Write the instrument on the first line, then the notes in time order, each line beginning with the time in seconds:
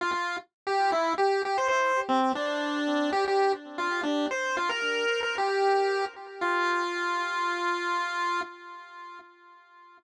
lead 1 (square)
0.01 F4
0.12 F4
0.67 G4
0.92 E4
1.18 G4
1.45 G4
1.58 C5
1.68 C5
2.09 C4
2.35 D4
3.12 G4
3.28 G4
3.78 F4
4.03 D4
4.31 C5
4.57 F4
4.69 A#4
5.23 A#4
5.38 G4
6.41 F4